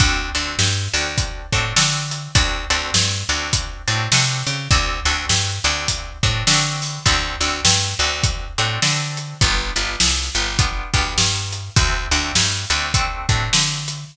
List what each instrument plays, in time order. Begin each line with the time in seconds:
0.00 electric bass (finger) D2, acoustic guitar (steel) C4 D4 F#4 A4, kick, closed hi-hat
0.35 electric bass (finger) D2, acoustic guitar (steel) C4 D4 F#4 A4, closed hi-hat
0.59 electric bass (finger) G2, snare
0.94 electric bass (finger) D2, acoustic guitar (steel) C4 D4 F#4 A4, closed hi-hat
1.18 kick, closed hi-hat
1.52 electric bass (finger) A2, acoustic guitar (steel) C4 D4 F#4 A4, kick, closed hi-hat
1.76 electric bass (finger) D3, acoustic guitar (steel) C4 D4 F#4 A4, snare
2.11 closed hi-hat
2.35 electric bass (finger) D2, acoustic guitar (steel) C4 D4 F#4 A4, kick, closed hi-hat
2.70 electric bass (finger) D2, acoustic guitar (steel) C4 D4 F#4 A4, closed hi-hat
2.94 electric bass (finger) G2, snare
3.29 electric bass (finger) D2, acoustic guitar (steel) C4 D4 F#4 A4, closed hi-hat
3.53 kick, closed hi-hat
3.87 electric bass (finger) A2, acoustic guitar (steel) C4 D4 F#4 A4, closed hi-hat
4.12 electric bass (finger) C3, acoustic guitar (steel) C4 D4 F#4 A4, snare
4.47 electric bass (finger) C#3, closed hi-hat
4.71 electric bass (finger) D2, acoustic guitar (steel) C4 D4 F#4 A4, kick, closed hi-hat
5.05 electric bass (finger) D2, acoustic guitar (steel) C4 D4 F#4 A4, closed hi-hat
5.29 electric bass (finger) G2, snare
5.64 electric bass (finger) D2, acoustic guitar (steel) C4 D4 F#4 A4, closed hi-hat
5.88 kick, closed hi-hat
6.23 electric bass (finger) A2, acoustic guitar (steel) C4 D4 F#4 A4, kick, closed hi-hat
6.47 electric bass (finger) D3, acoustic guitar (steel) C4 D4 F#4 A4, snare
6.82 open hi-hat
7.06 electric bass (finger) D2, acoustic guitar (steel) C4 D4 F#4 A4, kick, closed hi-hat
7.40 electric bass (finger) D2, acoustic guitar (steel) C4 D4 F#4 A4, closed hi-hat
7.65 electric bass (finger) G2, snare
7.99 electric bass (finger) D2, acoustic guitar (steel) C4 D4 F#4 A4, closed hi-hat
8.23 kick, closed hi-hat
8.58 electric bass (finger) A2, acoustic guitar (steel) C4 D4 F#4 A4, closed hi-hat
8.82 electric bass (finger) D3, acoustic guitar (steel) C4 D4 F#4 A4, snare
9.17 closed hi-hat
9.41 electric bass (finger) G1, acoustic guitar (steel) B3 D4 F4 G4, kick, closed hi-hat
9.76 electric bass (finger) G1, acoustic guitar (steel) B3 D4 F4 G4, closed hi-hat
10.00 electric bass (finger) C2, snare
10.35 electric bass (finger) G1, acoustic guitar (steel) B3 D4 F4 G4, closed hi-hat
10.59 acoustic guitar (steel) B3 D4 F4 G4, kick, closed hi-hat
10.94 electric bass (finger) D2, acoustic guitar (steel) B3 D4 F4 G4, kick, closed hi-hat
11.18 electric bass (finger) G2, snare
11.53 closed hi-hat
11.76 electric bass (finger) D2, acoustic guitar (steel) A3 C4 D4 F#4, kick, closed hi-hat
12.11 electric bass (finger) D2, acoustic guitar (steel) A3 C4 D4 F#4, closed hi-hat
12.35 electric bass (finger) G2, snare
12.70 electric bass (finger) D2, acoustic guitar (steel) A3 C4 D4 F#4, closed hi-hat
12.94 acoustic guitar (steel) A3 C4 D4 F#4, kick, closed hi-hat
13.29 electric bass (finger) A2, acoustic guitar (steel) A3 C4 D4 F#4, kick, closed hi-hat
13.53 electric bass (finger) D3, snare
13.88 closed hi-hat